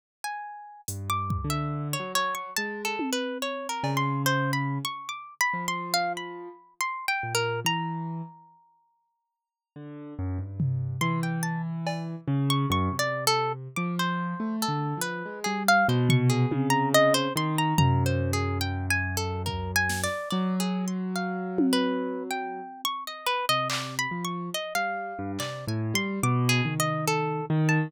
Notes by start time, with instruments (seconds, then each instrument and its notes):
0.24 orchestral harp G#5
0.88 acoustic grand piano G2, closed hi-hat
1.10 orchestral harp D6
1.30 kick
1.44 acoustic grand piano D3
1.50 orchestral harp E5
1.93 orchestral harp C#5
1.99 acoustic grand piano F#3
2.15 orchestral harp C#5
2.35 orchestral harp C#6
2.57 acoustic grand piano G#3, orchestral harp A5
2.85 orchestral harp A4
2.99 high tom
3.13 orchestral harp B4
3.42 orchestral harp C#5
3.69 orchestral harp A#4
3.83 acoustic grand piano C#3, cowbell
3.97 orchestral harp C6
4.26 orchestral harp C5
4.53 orchestral harp B5
4.85 orchestral harp C#6
5.09 orchestral harp D6
5.41 orchestral harp B5
5.54 acoustic grand piano F3
5.68 orchestral harp C6
5.94 orchestral harp F5
6.17 orchestral harp B5
6.81 orchestral harp C6
7.08 orchestral harp G5
7.23 acoustic grand piano A#2
7.35 orchestral harp A#4
7.65 acoustic grand piano E3, orchestral harp A#5
9.76 acoustic grand piano D3
10.19 acoustic grand piano F#2
10.39 acoustic grand piano G2
10.60 floor tom
11.01 acoustic grand piano E3, orchestral harp C6
11.23 orchestral harp G5
11.43 orchestral harp A5
11.87 cowbell
12.28 acoustic grand piano C#3
12.50 orchestral harp C#6
12.70 acoustic grand piano F#2, orchestral harp C#6
12.92 acoustic grand piano C3
12.99 orchestral harp D5
13.27 orchestral harp A4
13.76 acoustic grand piano F3, orchestral harp D6
13.99 orchestral harp C5
14.40 acoustic grand piano A3
14.62 orchestral harp A4
14.68 acoustic grand piano D3
14.97 acoustic grand piano F3
15.01 orchestral harp B4
15.26 acoustic grand piano G#3
15.44 acoustic grand piano G3, orchestral harp G#4
15.68 orchestral harp F5
15.88 acoustic grand piano B2, orchestral harp C5
16.09 orchestral harp C#6, floor tom
16.30 orchestral harp G#4
16.51 acoustic grand piano C#3, high tom
16.70 orchestral harp A#5
16.94 orchestral harp D#5
17.14 orchestral harp C5
17.36 acoustic grand piano D#3, orchestral harp C6
17.58 orchestral harp A#5
17.78 acoustic grand piano F#2, orchestral harp A#5, floor tom
18.06 orchestral harp C5
18.33 orchestral harp G#4
18.61 orchestral harp G5
18.90 orchestral harp G#5
19.17 orchestral harp A4
19.46 orchestral harp A#4, kick
19.76 orchestral harp G#5
19.89 snare
20.04 orchestral harp D5
20.30 acoustic grand piano F#3, orchestral harp D5
20.60 orchestral harp G#4
20.88 orchestral harp C6
21.16 orchestral harp F5
21.58 high tom
21.73 orchestral harp B4
22.31 orchestral harp G5
22.85 orchestral harp C#6
23.07 orchestral harp D#5
23.26 orchestral harp B4
23.49 acoustic grand piano C3, orchestral harp D#5
23.70 orchestral harp D5, clap
23.99 orchestral harp B5
24.11 acoustic grand piano F3
24.25 orchestral harp C#6
24.54 orchestral harp D#5
24.75 acoustic grand piano G3, orchestral harp F5
25.19 acoustic grand piano G2
25.39 acoustic grand piano C3, orchestral harp D5, clap
25.67 acoustic grand piano A2, orchestral harp G#5
25.94 acoustic grand piano G3, orchestral harp C6
26.23 acoustic grand piano B2, orchestral harp D6
26.49 orchestral harp G#4
26.65 acoustic grand piano D#3, floor tom
26.80 orchestral harp D#5
27.08 orchestral harp A4
27.50 acoustic grand piano D#3
27.69 orchestral harp A5